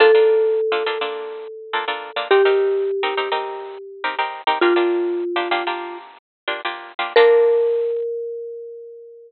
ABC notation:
X:1
M:4/4
L:1/16
Q:1/4=104
K:Bb
V:1 name="Marimba"
A16 | G16 | "^rit." F10 z6 | B16 |]
V:2 name="Acoustic Guitar (steel)"
[B,DFA] [B,DFA]4 [B,DFA] [B,DFA] [B,DFA]5 [B,DFA] [B,DFA]2 [B,DFA] | [CEGB] [CEGB]4 [CEGB] [CEGB] [CEGB]5 [CEGB] [CEGB]2 [CEGB] | "^rit." [B,DFG] [B,DFG]4 [B,DFG] [B,DFG] [B,DFG]5 [B,DFG] [B,DFG]2 [B,DFG] | [B,DFA]16 |]